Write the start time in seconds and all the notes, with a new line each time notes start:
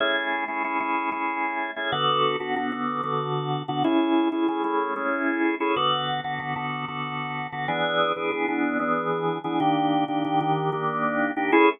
0.00 A3 C#4 E4 G#4
0.48 A3 C#4 E4 G#4
0.64 A3 C#4 E4 G#4
0.80 A3 C#4 E4 G#4
1.12 A3 C#4 E4 G#4
1.76 A3 C#4 E4 G#4
1.92 D3 B3 F#4 A4
2.40 D3 B3 F#4 A4
2.56 D3 B3 F#4 A4
2.72 D3 B3 F#4 A4
3.03 D3 B3 F#4 A4
3.68 D3 B3 F#4 A4
3.84 A3 C#4 E4 G#4
4.32 A3 C#4 E4 G#4
4.48 A3 C#4 E4 G#4
4.64 A3 C#4 E4 G#4
4.96 A3 C#4 E4 G#4
5.60 A3 C#4 E4 G#4
5.76 D3 B3 F#4 A4
6.24 D3 B3 F#4 A4
6.40 D3 B3 F#4 A4
6.56 D3 B3 F#4 A4
6.88 D3 B3 F#4 A4
7.52 D3 B3 F#4 A4
7.68 E3 B3 D4 G#4
8.16 E3 B3 D4 G#4
8.32 E3 B3 D4 G#4
8.48 E3 B3 D4 G#4
8.79 E3 B3 D4 G#4
9.44 E3 B3 D4 G#4
9.60 D#3 A#3 D4 G4
10.08 D#3 A#3 D4 G4
10.25 D#3 A#3 D4 G4
10.41 D#3 A#3 D4 G4
10.72 D#3 A#3 D4 G4
11.36 D#3 A#3 D4 G4
11.52 A3 C#4 E4 G#4